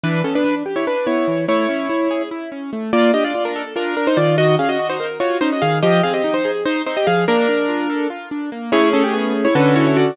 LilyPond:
<<
  \new Staff \with { instrumentName = "Acoustic Grand Piano" } { \time 7/8 \key a \mixolydian \tempo 4 = 145 <d' b'>8 <cis' a'>16 <d' b'>8 r8 <e' cis''>16 <d' b'>8 <e' cis''>4 | <e' cis''>2 r4. | \key bes \mixolydian <f' d''>8 <g' ees''>16 <f' d''>8 <d' bes'>8 r16 <d' bes'>8 <d' bes'>16 <ees' c''>16 <f' d''>8 | <ges' ees''>8 <aes' f''>16 <ges' ees''>8 <ees' c''>8 r16 <f' des''>8 <ees' c''>16 <ges' ees''>16 <aes' f''>8 |
<g' ees''>8 <aes' f''>16 <g' ees''>8 <ees' c''>8 r16 <ees' c''>8 <ees' c''>16 <g' ees''>16 <aes' f''>8 | <d' bes'>2 r4. | \key a \mixolydian <e' cis''>8 <cis' a'>16 g'16 <b gis'>8 r16 <e' cis''>16 <d' b'>8 <e' cis''>16 <e' cis''>16 <fis' d''>8 | }
  \new Staff \with { instrumentName = "Acoustic Grand Piano" } { \time 7/8 \key a \mixolydian e8 b8 d'8 g'8 r8 b8 e8 | a8 cis'8 e'8 gis'8 e'8 cis'8 a8 | \key bes \mixolydian bes8 d'8 f'8 a'8 f'8 r8 ees8~ | ees8 des'8 ges'8 bes'8 ges'8 des'8 ees8 |
f8 c'8 ees'8 aes'8 r8 c'8 f8 | bes8 d'8 f'8 a'8 f'8 d'8 bes8 | \key a \mixolydian <a cis' gis'>2 <d cis' fis' a'>4. | }
>>